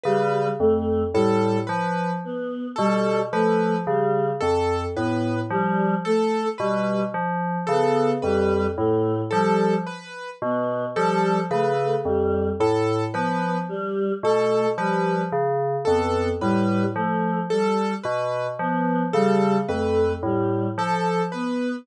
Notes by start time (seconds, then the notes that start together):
0.03 C#3 G3 B4
0.60 F2 A3
1.14 A2 G3 A4
1.67 F3 B4
2.24 B3
2.76 B2 G3 A4
3.32 F3 A3 B4
3.87 C#3 G3
4.40 F2 A4
4.96 A2 B3 B4
5.50 F3 G3
6.05 A3 A4
6.58 B2 G3 B4
7.14 F3
7.67 C#3 B3 A4
8.22 F2 G3 B4
8.77 A2 A3
9.30 F3 G3 A4
9.87 B4
10.42 B2 B3
10.95 F3 G3 A4
11.51 C#3 A3 B4
12.05 F2 G3
12.60 A2 A4
13.14 F3 B3 B4
13.69 G3
14.23 B2 A3 A4
14.78 F3 G3 B4
15.32 C#3
15.85 F2 B3 A4
16.41 A2 G3 B4
16.95 F3 A3
17.50 G3 A4
18.03 B2 B4
18.59 F3 B3
19.13 C#3 G3 A4
19.68 F2 A3 B4
20.23 A2 G3
20.78 F3 A4
21.32 B3 B4